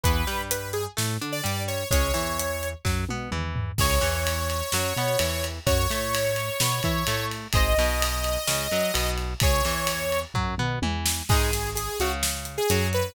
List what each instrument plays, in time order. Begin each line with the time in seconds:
0.03 synth bass 1 E2, overdriven guitar E3 B3, lead 2 (sawtooth) B4, kick, closed hi-hat
0.27 synth bass 1 G2, overdriven guitar G3, snare, closed hi-hat
0.51 lead 2 (sawtooth) B4, closed hi-hat
0.73 lead 2 (sawtooth) G#4, closed hi-hat
0.97 synth bass 1 A2, overdriven guitar A3, snare
1.21 synth bass 1 D3, overdriven guitar D4, closed hi-hat
1.32 lead 2 (sawtooth) D5
1.44 synth bass 1 G2, overdriven guitar G3, closed hi-hat
1.68 lead 2 (sawtooth) C#5, closed hi-hat
1.91 synth bass 1 C#2, overdriven guitar G#3 C#4, lead 2 (sawtooth) C#5, kick, closed hi-hat
2.14 synth bass 1 E2, overdriven guitar E3, snare, closed hi-hat
2.39 closed hi-hat
2.63 closed hi-hat
2.85 synth bass 1 F#2, overdriven guitar F#3, kick, snare
3.09 synth bass 1 B2, overdriven guitar B3, high tom
3.31 synth bass 1 E2, overdriven guitar E3, mid tom
3.56 floor tom
3.78 synth bass 1 C#2, overdriven guitar G#4 C#5, lead 2 (sawtooth) C#5, kick, crash
4.01 synth bass 1 E2, overdriven guitar E3, snare, ride
4.27 ride
4.50 ride
4.72 synth bass 1 F#2, overdriven guitar F#3, snare
4.96 synth bass 1 B2, overdriven guitar B3, ride
5.19 synth bass 1 E2, overdriven guitar E3, ride
5.44 ride
5.66 synth bass 1 F#2, overdriven guitar F#4 C#5, lead 2 (sawtooth) C#5, kick, ride
5.89 synth bass 1 A2, overdriven guitar A3, snare, ride
6.15 ride
6.36 ride
6.60 synth bass 1 B2, overdriven guitar B3, snare
6.83 synth bass 1 E3, overdriven guitar E4, kick, ride
7.07 synth bass 1 A2, overdriven guitar A3, ride
7.31 ride
7.53 synth bass 1 G#1, overdriven guitar G#4 C5, lead 2 (sawtooth) D#5, kick, ride
7.57 overdriven guitar D#5
7.78 synth bass 1 B1, overdriven guitar B2, snare, ride
8.02 ride
8.24 ride
8.47 synth bass 1 C#2, overdriven guitar C#3, snare
8.71 synth bass 1 F#2, overdriven guitar F#3, ride
8.94 synth bass 1 B1, overdriven guitar B2, ride
9.18 ride
9.40 synth bass 1 C#2, overdriven guitar G#4, lead 2 (sawtooth) C#5, kick, ride
9.44 overdriven guitar C#5
9.65 synth bass 1 E2, overdriven guitar E3, snare, ride
9.87 ride
10.12 ride
10.34 synth bass 1 F#2, overdriven guitar F#3, kick, floor tom
10.58 synth bass 1 B2, overdriven guitar B3, mid tom
10.82 synth bass 1 E2, overdriven guitar E3, high tom
11.06 snare
11.29 synth bass 1 G#1, overdriven guitar G#3 D#4, lead 2 (sawtooth) G#4, kick, crash
11.53 snare, closed hi-hat
11.75 lead 2 (sawtooth) G#4, closed hi-hat
11.99 synth bass 1 C#2, overdriven guitar C#3, lead 2 (sawtooth) F#4, closed hi-hat
12.23 snare
12.45 closed hi-hat
12.58 lead 2 (sawtooth) G#4
12.70 synth bass 1 F#2, overdriven guitar F#3, closed hi-hat
12.93 lead 2 (sawtooth) B4, closed hi-hat